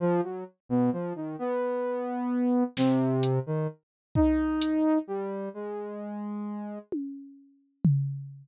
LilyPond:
<<
  \new Staff \with { instrumentName = "Lead 2 (sawtooth)" } { \time 9/8 \tempo 4. = 43 f16 fis16 r16 b,16 f16 dis16 b4. c8. dis16 r8 | dis'4 g8 gis4. r4. | }
  \new DrumStaff \with { instrumentName = "Drums" } \drummode { \time 9/8 r4. r4. sn8 hh4 | bd8 hh4 r4. tommh4 tomfh8 | }
>>